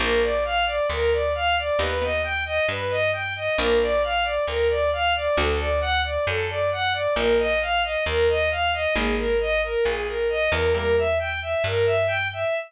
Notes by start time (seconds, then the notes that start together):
0.00 A#1 A#3 D4 F4 A#4
0.22 D5
0.45 F5
0.66 D5
0.90 D2 A#4
1.12 D5
1.35 F5
1.58 D5
1.79 D#2 B3 D#4 G4 B4
2.01 B3 D#4 G4 D#5
2.24 G5
2.45 D#5
2.68 G2 B4
2.90 D#5
3.13 G5
3.36 D#5
3.57 A#1 A#3 D4 F4 A#4
3.81 D5
4.03 F5
4.23 D5
4.47 D2 A#4
4.70 D5
4.93 F5
5.15 D5
5.37 D2 A3 D4 F#4 A4
5.59 D5
5.80 F#5
6.04 D5
6.27 F#2 A4
6.49 D5
6.72 F#5
6.93 D5
7.15 A#1 A#3 D#4 F4 A#4
7.39 D#5
7.61 F5
7.83 D#5
8.06 D#2 A#4
8.29 D#5
8.51 F5
8.73 D#5
8.95 G#1 G#3 A#3 D#4 G#4
9.16 A#4
9.40 D#5
9.63 A#4
9.85 A#1 G#4
10.07 A#4
10.29 D#5
10.51 E2 A#4
10.75 G3 A#3 E4 A#4
10.98 E5
11.19 G5
11.42 E5
11.64 G2 A#4
11.86 E5
12.07 G5
12.33 E5